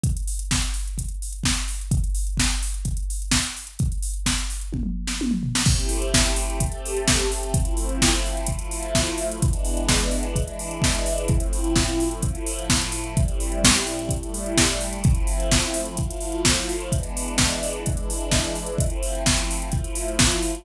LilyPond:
<<
  \new Staff \with { instrumentName = "String Ensemble 1" } { \time 4/4 \key a \minor \tempo 4 = 128 r1 | r1 | r1 | <a c' e' g'>2 <a c' g' a'>2 |
<f a c' e'>2 <f a e' f'>2 | <e gis b d'>2 <e gis d' e'>2 | <a, f c' e'>2 <a, f a e'>2 | <a, g c' e'>2 <a, g a e'>2 |
<f a c' e'>2 <f a e' f'>2 | <e gis b d'>2 <e gis d' e'>2 | <f a c' e'>2 <f a e' f'>2 | }
  \new DrumStaff \with { instrumentName = "Drums" } \drummode { \time 4/4 <hh bd>16 hh16 hho16 hh16 <bd sn>16 hh16 hho16 hh16 <hh bd>16 hh16 hho16 hh16 <bd sn>16 hh16 hho16 hh16 | <hh bd>16 hh16 hho16 hh16 <bd sn>16 hh16 hho16 hh16 <hh bd>16 hh16 hho16 hh16 <bd sn>16 hh16 hho16 hh16 | <hh bd>16 hh16 hho16 hh16 <bd sn>16 hh16 hho16 hh16 <bd tommh>16 toml8 sn16 tommh16 toml16 tomfh16 sn16 | <cymc bd>16 hh16 hho16 hh16 <bd sn>16 hh16 hho16 hh16 <hh bd>16 hh16 hho16 hh16 <bd sn>16 hh16 hho16 hh16 |
<hh bd>16 hh16 hho16 hh16 <bd sn>16 hh16 hho16 hh16 <hh bd>16 hh16 hho16 hh16 <bd sn>16 hh16 hho16 hh16 | <hh bd>16 hh16 hho16 hh16 <bd sn>16 hh16 hho16 hh16 <hh bd>16 hh16 hho16 hh16 <bd sn>16 hh16 hho16 hh16 | <hh bd>16 hh16 hho16 hh16 <bd sn>16 hh16 hho16 hh16 <hh bd>16 hh16 hho16 hh16 <bd sn>16 hh16 hho16 hh16 | <hh bd>16 hh16 hho16 hh16 <bd sn>16 hh16 hho16 hh16 <hh bd>16 hh16 hho16 hh16 <bd sn>16 hh16 hho16 hh16 |
<hh bd>16 hh16 hho16 hh16 <bd sn>16 hh16 hho16 hh16 <hh bd>16 hh16 hho16 hh16 <bd sn>16 hh16 hho16 hh16 | <hh bd>16 hh16 hho16 hh16 <bd sn>16 hh16 hho16 hh16 <hh bd>16 hh16 hho16 hh16 <bd sn>16 hh16 hho16 hh16 | <hh bd>16 hh16 hho16 hh16 <bd sn>16 hh16 hho16 hh16 <hh bd>16 hh16 hho16 hh16 <bd sn>16 hh16 hho16 hh16 | }
>>